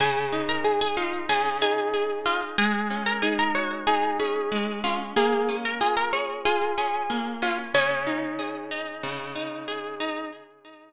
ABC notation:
X:1
M:4/4
L:1/16
Q:1/4=93
K:Db
V:1 name="Acoustic Guitar (steel)"
[Aa]3 [Bb] [Aa] [Aa] [Ff]2 [Aa]2 [Aa]4 [Ff] z | [Aa]3 [Bb] [Aa] [Bb] [dd']2 [Aa]2 [Aa]4 [Ff] z | [Aa]3 [Bb] [Aa] [Bb] [dd']2 [Aa]2 [Aa]4 [Ff] z | [Dd]8 z8 |]
V:2 name="Acoustic Guitar (steel)"
D,2 E2 z2 E2 D,2 E2 A2 E2 | A,2 D2 E2 G2 E2 D2 A,2 D2 | B,2 D2 F2 A2 F2 D2 B,2 D2 | D,2 E2 A2 E2 D,2 E2 A2 E2 |]